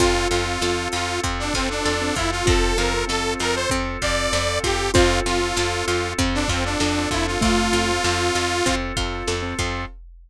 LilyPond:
<<
  \new Staff \with { instrumentName = "Lead 2 (sawtooth)" } { \time 4/4 \key f \major \tempo 4 = 97 f'8 f'4 f'8 r16 d'16 c'16 d'8. e'16 f'16 | a'8 bes'8 a'8 bes'16 c''16 r8 d''4 g'8 | f'8 f'4 f'8 r16 d'16 c'16 d'8. e'16 f'16 | f'2~ f'8 r4. | }
  \new Staff \with { instrumentName = "Xylophone" } { \time 4/4 \key f \major f'1 | f'2. r4 | f'4 r2 d'4 | a4 r2. | }
  \new Staff \with { instrumentName = "Acoustic Grand Piano" } { \time 4/4 \key f \major <c' f' a'>16 <c' f' a'>16 <c' f' a'>16 <c' f' a'>16 <c' f' a'>4. <c' f' a'>8. <c' f' a'>16 <c' f' a'>8~ | <c' f' a'>16 <c' f' a'>16 <c' f' a'>16 <c' f' a'>16 <c' f' a'>4. <c' f' a'>8. <c' f' a'>16 <c' f' a'>8 | <c' f' a'>16 <c' f' a'>16 <c' f' a'>16 <c' f' a'>16 <c' f' a'>4. <c' f' a'>8. <c' f' a'>16 <c' f' a'>8~ | <c' f' a'>16 <c' f' a'>16 <c' f' a'>16 <c' f' a'>16 <c' f' a'>4. <c' f' a'>8. <c' f' a'>16 <c' f' a'>8 | }
  \new Staff \with { instrumentName = "Pizzicato Strings" } { \time 4/4 \key f \major c'8 f'8 a'8 f'8 c'8 f'8 a'8 f'8 | c'8 f'8 a'8 f'8 c'8 f'8 a'8 f'8 | c'8 f'8 a'8 f'8 c'8 f'8 a'8 f'8 | c'8 f'8 a'8 f'8 c'8 f'8 a'8 f'8 | }
  \new Staff \with { instrumentName = "Electric Bass (finger)" } { \clef bass \time 4/4 \key f \major f,8 f,8 f,8 f,8 f,8 f,8 f,8 f,8 | f,8 f,8 f,8 f,8 f,8 f,8 f,8 f,8 | f,8 f,8 f,8 f,8 f,8 f,8 f,8 f,8 | f,8 f,8 f,8 f,8 f,8 f,8 f,8 f,8 | }
  \new Staff \with { instrumentName = "Drawbar Organ" } { \time 4/4 \key f \major <c' f' a'>1~ | <c' f' a'>1 | <c' f' a'>1~ | <c' f' a'>1 | }
  \new DrumStaff \with { instrumentName = "Drums" } \drummode { \time 4/4 <hh bd>8 hh8 sn8 hh8 <hh bd>8 <hh bd>8 sn8 <hh bd>8 | <hh bd>8 hh8 sn8 hh8 <hh bd>8 <hh bd>8 sn8 <hh bd>8 | <hh bd>8 hh8 sn8 hh8 <hh bd>8 <hh bd>8 sn8 <hh bd>8 | <hh bd>8 hh8 sn8 hh8 <hh bd>8 <hh bd>8 sn8 <hh bd>8 | }
>>